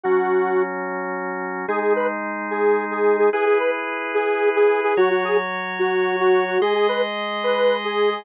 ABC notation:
X:1
M:12/8
L:1/8
Q:3/8=146
K:G#m
V:1 name="Lead 1 (square)"
F5 z7 | G G B z3 G3 G2 G | G G B z3 G3 G2 G | F F G z3 F3 F2 F |
G G B z3 B3 G2 G |]
V:2 name="Drawbar Organ"
[F,CF]12 | [G,DG]12 | [EGB]12 | [F,Fc]12 |
[G,Gd]12 |]